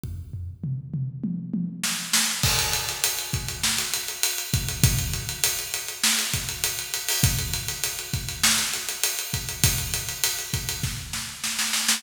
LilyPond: \new DrumStaff \drummode { \time 4/4 \tempo 4 = 100 <bd tomfh>8 tomfh8 toml8 toml8 tommh8 tommh8 sn8 sn8 | <cymc bd>16 hh16 hh16 hh16 hh16 hh16 <hh bd>16 hh16 sn16 hh16 hh16 hh16 hh16 hh16 <hh bd>16 hh16 | <hh bd>16 hh16 hh16 hh16 hh16 hh16 hh16 hh16 sn16 hh16 <hh bd>16 hh16 hh16 hh16 hh16 hho16 | <hh bd>16 hh16 hh16 hh16 hh16 hh16 <hh bd>16 hh16 sn16 hh16 hh16 hh16 hh16 hh16 <hh bd>16 hh16 |
<hh bd>16 hh16 hh16 hh16 hh16 hh16 <hh bd>16 hh16 <bd sn>8 sn8 sn16 sn16 sn16 sn16 | }